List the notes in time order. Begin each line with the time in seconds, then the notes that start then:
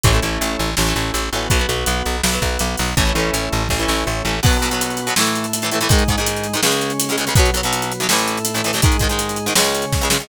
0.04 A1 E3 A3 C#4 E4, kick, closed hi-hat
0.08 C#4
0.13 E3 A3 C#4
0.22 A1 E3 A3 C#4, closed hi-hat
0.41 A1, closed hi-hat
0.59 A1, closed hi-hat
0.77 A1 A3 C#4 E4, snare
0.87 E3 A3 C#4
0.96 A1, closed hi-hat
1.14 A1, closed hi-hat
1.32 A1 E3 A3 B3 C#4 F#4, closed hi-hat
1.50 B1 F#3 B3, kick, closed hi-hat
1.59 F#3 B3
1.69 B1 F#3 B3, closed hi-hat
1.86 B1, closed hi-hat
2.06 B1, closed hi-hat
2.23 B1 B3 F#4, snare
2.33 F#3 B3
2.42 B1, kick, closed hi-hat
2.59 B1, closed hi-hat
2.77 B1 F#3 B3, open hi-hat
2.97 A1 E3 A3 C#4 E4, kick, closed hi-hat
3.06 E3 A3 C#4
3.15 A1 E3 A3, closed hi-hat
3.19 C#4
3.33 A1, closed hi-hat
3.52 A1, closed hi-hat
3.69 A1 A3 C#4 E4, kick, snare
3.79 E3 A3 C#4
3.88 A1, snare
4.07 A1
4.25 A1 E3 A3 C#4
4.43 B2 F#3 B3 F#4, kick, crash
4.53 closed hi-hat
4.62 B2 F#3 B3, closed hi-hat
4.71 B2 F#3 B3, closed hi-hat
4.81 closed hi-hat
4.90 closed hi-hat
4.97 closed hi-hat
5.07 B2 F#3 B3, closed hi-hat
5.16 A2 E3 A3 E4, snare
5.20 A3
5.27 closed hi-hat
5.35 closed hi-hat
5.44 closed hi-hat
5.53 closed hi-hat
5.62 A2 E3, closed hi-hat
5.66 A3
5.71 A2 E3 A3, closed hi-hat
5.81 A2 E3 A3, closed hi-hat
5.89 G#2 D#3 G#3 D#4, kick, closed hi-hat
5.99 closed hi-hat
6.08 G#2 D#3 G#3, kick, closed hi-hat
6.18 G#2 D#3 G#3, closed hi-hat
6.27 closed hi-hat
6.36 closed hi-hat
6.44 closed hi-hat
6.53 G#2 D#3 G#3, closed hi-hat
6.63 C#2 C#3 G#3 C#4, snare
6.72 closed hi-hat
6.81 closed hi-hat
6.90 closed hi-hat
7.00 closed hi-hat
7.09 C#2 C#3 G#3, closed hi-hat
7.17 C#2 C#3 G#3, closed hi-hat
7.27 C#2 C#3 G#3, closed hi-hat
7.35 B1 B2 F#3 B3, kick, closed hi-hat
7.46 closed hi-hat
7.54 B1 B2 F#3, closed hi-hat
7.63 B1 B2 F#3, closed hi-hat
7.73 closed hi-hat
7.82 closed hi-hat
7.92 closed hi-hat
8.00 B1 B2 F#3, closed hi-hat
8.09 A1 A2 E3 A3 E4, snare
8.19 closed hi-hat
8.28 closed hi-hat
8.37 closed hi-hat
8.45 closed hi-hat
8.54 A1 A2 E3, closed hi-hat
8.64 A1 A2 E3, closed hi-hat
8.73 A1 A2, closed hi-hat
8.77 E3
8.82 G#2 D#3 G#3 D#4, kick, closed hi-hat
8.92 closed hi-hat
8.99 G#2 D#3, kick, closed hi-hat
9.04 G#3
9.09 G#2 D#3 G#3, closed hi-hat
9.19 closed hi-hat
9.29 closed hi-hat
9.36 closed hi-hat
9.46 G#2 D#3 G#3, closed hi-hat
9.55 C#2 C#3 G#3 C#4, snare
9.64 closed hi-hat
9.75 closed hi-hat
9.82 closed hi-hat
9.92 kick, snare
10.01 C#2 C#3 G#3
10.10 C#2 C#3 G#3, snare
10.20 C#2 C#3 G#3